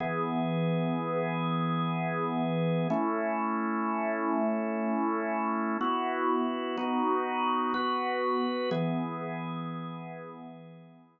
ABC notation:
X:1
M:9/8
L:1/8
Q:3/8=62
K:E
V:1 name="Drawbar Organ"
[E,B,G]9 | [A,CE]9 | [B,EF]3 [B,DF]3 [B,FB]3 | [E,B,G]9 |]